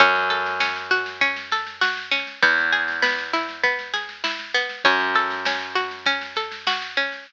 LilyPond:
<<
  \new Staff \with { instrumentName = "Pizzicato Strings" } { \time 4/4 \key fis \dorian \tempo 4 = 99 cis'8 a'8 cis'8 fis'8 cis'8 a'8 fis'8 cis'8 | b8 gis'8 b8 e'8 b8 gis'8 e'8 b8 | cis'8 a'8 cis'8 fis'8 cis'8 a'8 fis'8 cis'8 | }
  \new Staff \with { instrumentName = "Electric Bass (finger)" } { \clef bass \time 4/4 \key fis \dorian fis,1 | e,1 | fis,1 | }
  \new DrumStaff \with { instrumentName = "Drums" } \drummode { \time 4/4 <bd sn>16 sn16 sn16 sn16 sn16 sn16 sn16 sn16 <bd sn>16 sn16 sn16 sn16 sn16 sn16 sn16 sn16 | <bd sn>16 sn16 sn16 sn16 sn16 sn16 sn16 sn16 <bd sn>16 sn16 sn16 sn16 sn16 sn16 sn16 sn16 | <bd sn>16 sn16 sn16 sn16 sn16 sn16 sn16 sn16 <bd sn>16 sn16 sn16 sn16 sn16 sn16 sn16 sn16 | }
>>